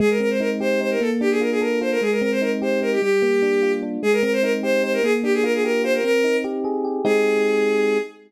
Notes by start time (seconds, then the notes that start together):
0.00 G#3 G#4
0.10 A#4
0.20 C4 A#4
0.30 C5
0.40 D#4 A#4
0.60 G4 C5
0.81 D#4 C5
0.91 A#4
1.01 A#3 A4
1.21 D4 G4
1.31 G#4
1.41 F4 A#4
1.51 G#4
1.61 A4 A#4
1.81 F4 C5
1.91 A#4
2.01 G#3 G#4
2.11 A#4
2.21 C4 A#4
2.32 C5
2.42 D#4 A#4
2.62 G4 C5
2.82 D#4 A#4
2.92 G4
3.02 G3 G4
3.22 A#3
3.42 D4
3.62 F4
3.83 D4
4.03 G#3 G#4
4.13 A#4
4.23 C4 A#4
4.33 C5
4.43 D#4 A#4
4.63 G4 C5
4.83 D#4 C5
4.93 A#4
5.03 A#3 G#4
5.23 D4 G4
5.34 G#4
5.44 F4 A#4
5.54 G#4
5.64 G4 A#4
5.84 F4 C5
5.94 A#4
6.04 C4 A#4
6.24 D#4
6.44 G4
6.64 G#4
6.85 G4
7.05 G#3 C4 D#4 G4 G#4